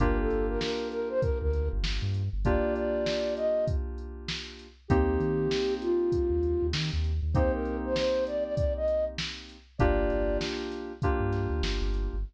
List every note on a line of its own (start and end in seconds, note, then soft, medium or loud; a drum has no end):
0.00 0.28 G1 loud
0.00 2.22 A#3 loud
0.00 2.22 D4 medium
0.00 2.22 F4 medium
0.00 2.22 G4 medium
0.00 0.17 A#4 medium
0.00 kick medium
0.00 closed hi-hat loud
0.20 0.46 A4 medium
0.30 0.59 G1 medium
0.30 closed hi-hat medium
0.49 0.61 A#4 medium
0.61 0.89 A#4 medium
0.61 snare loud
0.91 1.09 A#4 medium
0.91 closed hi-hat medium
1.10 1.21 C5 medium
1.21 1.39 A#4 medium
1.21 kick loud
1.21 closed hi-hat loud
1.42 1.69 D2 loud
1.42 1.69 A#4 medium
1.53 closed hi-hat medium
1.73 1.83 G1 loud
1.83 2.00 G1 medium
1.83 snare loud
2.02 2.29 G2 medium
2.14 closed hi-hat medium
2.33 2.60 G1 medium
2.45 4.67 A#3 medium
2.45 4.67 D4 medium
2.45 4.67 F4 medium
2.45 4.67 G4 medium
2.45 2.74 D5 medium
2.45 kick loud
2.45 closed hi-hat loud
2.75 3.34 D5 medium
2.75 closed hi-hat medium
3.06 snare loud
3.37 3.65 D#5 medium
3.37 closed hi-hat medium
3.67 kick loud
3.67 closed hi-hat loud
3.98 closed hi-hat medium
4.28 snare loud
4.59 closed hi-hat medium
4.88 5.19 D#2 loud
4.88 7.11 A#3 medium
4.88 7.11 C4 loud
4.88 7.11 D#4 medium
4.88 5.74 G4 medium
4.88 7.11 G4 loud
4.88 kick loud
4.88 closed hi-hat loud
5.20 5.48 D#3 loud
5.20 closed hi-hat medium
5.51 snare loud
5.81 6.66 F4 medium
5.81 closed hi-hat medium
6.12 kick medium
6.12 closed hi-hat loud
6.30 6.57 D#2 medium
6.43 closed hi-hat medium
6.63 6.73 D#2 medium
6.73 6.91 D#3 medium
6.73 snare loud
6.93 7.20 D#2 medium
7.04 closed hi-hat medium
7.22 7.49 D#2 medium
7.34 9.57 A#3 medium
7.34 9.57 C4 medium
7.34 9.57 D#4 medium
7.34 9.57 G4 medium
7.34 7.52 C5 medium
7.34 kick loud
7.34 closed hi-hat loud
7.53 7.77 A#4 medium
7.65 closed hi-hat medium
7.85 7.96 C5 medium
7.96 8.24 C5 medium
7.96 snare loud
8.27 8.44 D5 medium
8.27 closed hi-hat medium
8.44 8.55 D5 medium
8.56 8.73 D5 medium
8.56 kick loud
8.56 closed hi-hat loud
8.77 9.05 D#5 medium
8.88 closed hi-hat medium
9.18 snare loud
9.49 closed hi-hat medium
9.78 10.09 G1 loud
9.78 10.92 A#3 loud
9.78 10.92 D4 loud
9.78 10.92 F4 medium
9.78 10.92 G4 loud
9.78 10.38 D5 medium
9.78 kick loud
9.78 closed hi-hat loud
10.10 10.38 G1 medium
10.10 closed hi-hat medium
10.41 snare loud
10.71 snare soft
10.71 closed hi-hat medium
11.02 12.16 A#3 medium
11.02 12.16 D4 medium
11.02 12.16 F4 medium
11.02 12.16 G4 medium
11.02 kick loud
11.02 closed hi-hat loud
11.20 11.47 G2 medium
11.33 snare soft
11.33 closed hi-hat medium
11.50 11.61 D2 medium
11.63 11.80 G1 medium
11.63 snare loud
11.82 12.09 G1 medium
11.94 closed hi-hat medium
12.14 12.24 G1 medium